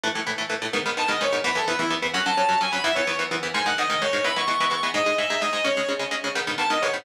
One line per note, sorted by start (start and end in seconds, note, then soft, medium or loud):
0.04 0.08 A2 medium
0.04 0.08 E3 medium
0.04 0.08 A3 medium
0.15 0.20 A2 medium
0.15 0.20 E3 medium
0.15 0.20 A3 medium
0.27 0.31 A2 medium
0.27 0.31 E3 medium
0.27 0.31 A3 medium
0.38 0.43 A2 medium
0.38 0.43 E3 medium
0.38 0.43 A3 medium
0.50 0.54 A2 medium
0.50 0.54 E3 medium
0.50 0.54 A3 medium
0.62 0.66 A2 medium
0.62 0.66 E3 medium
0.62 0.66 A3 medium
0.73 0.78 G#2 medium
0.73 0.78 D#3 medium
0.73 0.78 B3 medium
0.86 0.90 G#2 medium
0.86 0.90 D#3 medium
0.86 0.90 B3 medium
0.97 1.02 G#2 medium
0.97 1.02 D#3 medium
0.97 1.02 B3 medium
0.97 1.10 A5 medium
1.08 1.13 G#2 medium
1.08 1.13 D#3 medium
1.08 1.13 B3 medium
1.08 1.19 D#5 medium
1.21 1.25 G#2 medium
1.21 1.25 D#3 medium
1.21 1.25 B3 medium
1.21 1.34 C#5 medium
1.33 1.37 G#2 medium
1.33 1.37 D#3 medium
1.33 1.37 B3 medium
1.44 1.49 E2 medium
1.44 1.49 E3 loud
1.44 1.49 B3 medium
1.44 1.57 B4 medium
1.55 1.60 E2 medium
1.55 1.60 E3 medium
1.55 1.60 B3 medium
1.55 1.65 A4 medium
1.68 1.72 E2 medium
1.68 1.72 E3 medium
1.68 1.72 B3 medium
1.68 1.79 B4 medium
1.79 1.84 E2 medium
1.79 1.84 E3 medium
1.79 1.84 B3 medium
1.79 1.89 E4 medium
1.90 1.95 E2 medium
1.90 1.95 E3 medium
1.90 1.95 B3 medium
2.02 2.07 E2 medium
2.02 2.07 E3 medium
2.02 2.07 B3 medium
2.14 2.19 F#2 medium
2.14 2.19 F#3 medium
2.14 2.19 C#4 medium
2.14 2.25 F#5 medium
2.26 2.31 F#2 medium
2.26 2.31 F#3 medium
2.26 2.31 C#4 medium
2.26 2.59 A5 medium
2.37 2.42 F#2 medium
2.37 2.42 F#3 medium
2.37 2.42 C#4 medium
2.49 2.53 F#2 medium
2.49 2.53 F#3 medium
2.49 2.53 C#4 medium
2.61 2.65 F#2 medium
2.61 2.65 F#3 medium
2.61 2.65 C#4 medium
2.61 2.73 G#5 medium
2.72 2.77 F#2 medium
2.72 2.77 F#3 medium
2.72 2.77 C#4 medium
2.72 2.82 B5 medium
2.84 2.89 E2 medium
2.84 2.89 E3 loud
2.84 2.89 B3 medium
2.84 2.94 E5 medium
2.95 3.01 E2 medium
2.95 3.01 E3 medium
2.95 3.01 B3 medium
2.95 3.17 C#5 medium
3.07 3.12 E2 medium
3.07 3.12 E3 medium
3.07 3.12 B3 medium
3.19 3.24 E2 medium
3.19 3.24 E3 medium
3.19 3.24 B3 medium
3.31 3.36 E2 medium
3.31 3.36 E3 medium
3.31 3.36 B3 medium
3.43 3.48 E2 medium
3.43 3.48 E3 medium
3.43 3.48 B3 medium
3.54 3.59 G#2 medium
3.54 3.59 D#3 medium
3.54 3.59 G#3 medium
3.54 3.64 G#5 medium
3.66 3.71 G#2 medium
3.66 3.71 D#3 medium
3.66 3.71 G#3 medium
3.66 3.78 F#5 medium
3.78 3.83 G#2 medium
3.78 3.83 D#3 medium
3.78 3.83 G#3 medium
3.78 4.00 D#5 medium
3.90 3.94 G#2 medium
3.90 3.94 D#3 medium
3.90 3.94 G#3 medium
4.02 4.06 G#2 medium
4.02 4.06 D#3 medium
4.02 4.06 G#3 medium
4.02 4.24 C#5 medium
4.13 4.18 G#2 medium
4.13 4.18 D#3 medium
4.13 4.18 G#3 medium
4.24 4.29 E3 medium
4.24 4.29 G#3 medium
4.24 4.29 B3 medium
4.24 4.35 B5 medium
4.36 4.41 E3 medium
4.36 4.41 G#3 medium
4.36 4.41 B3 medium
4.36 4.47 C#6 medium
4.47 4.52 E3 medium
4.47 4.52 G#3 medium
4.47 4.52 B3 medium
4.47 4.69 C#6 medium
4.60 4.65 E3 medium
4.60 4.65 G#3 medium
4.60 4.65 B3 medium
4.70 4.75 E3 medium
4.70 4.75 G#3 medium
4.70 4.75 B3 medium
4.70 4.89 C#6 medium
4.83 4.88 E3 medium
4.83 4.88 G#3 medium
4.83 4.88 B3 medium
4.94 4.99 G#2 loud
4.94 4.99 G#3 medium
4.94 4.99 D#4 medium
4.94 5.15 D#5 medium
5.06 5.11 G#2 medium
5.06 5.11 G#3 medium
5.06 5.11 D#4 medium
5.18 5.23 G#2 medium
5.18 5.23 G#3 medium
5.18 5.23 D#4 medium
5.18 5.41 E5 medium
5.30 5.35 G#2 medium
5.30 5.35 G#3 medium
5.30 5.35 D#4 medium
5.41 5.46 G#2 medium
5.41 5.46 G#3 medium
5.41 5.46 D#4 medium
5.41 5.63 D#5 medium
5.53 5.58 G#2 medium
5.53 5.58 G#3 medium
5.53 5.58 D#4 medium
5.64 5.69 C#3 medium
5.64 5.69 G#3 medium
5.64 5.69 C#4 medium
5.64 5.88 C#5 medium
5.77 5.82 C#3 medium
5.77 5.82 G#3 medium
5.77 5.82 C#4 medium
5.89 5.93 C#3 medium
5.89 5.93 G#3 medium
5.89 5.93 C#4 medium
5.99 6.04 C#3 medium
5.99 6.04 G#3 medium
5.99 6.04 C#4 medium
6.11 6.16 C#3 medium
6.11 6.16 G#3 medium
6.11 6.16 C#4 medium
6.24 6.29 C#3 medium
6.24 6.29 G#3 medium
6.24 6.29 C#4 medium
6.35 6.40 G#2 medium
6.35 6.40 D#3 medium
6.35 6.40 B3 medium
6.47 6.52 G#2 medium
6.47 6.52 D#3 medium
6.47 6.52 B3 medium
6.58 6.63 G#2 medium
6.58 6.63 D#3 medium
6.58 6.63 B3 medium
6.58 6.69 A5 medium
6.70 6.75 G#2 medium
6.70 6.75 D#3 medium
6.70 6.75 B3 medium
6.70 6.81 D#5 medium
6.82 6.87 G#2 medium
6.82 6.87 D#3 medium
6.82 6.87 B3 medium
6.82 6.93 C#5 medium
6.94 6.98 G#2 medium
6.94 6.98 D#3 medium
6.94 6.98 B3 medium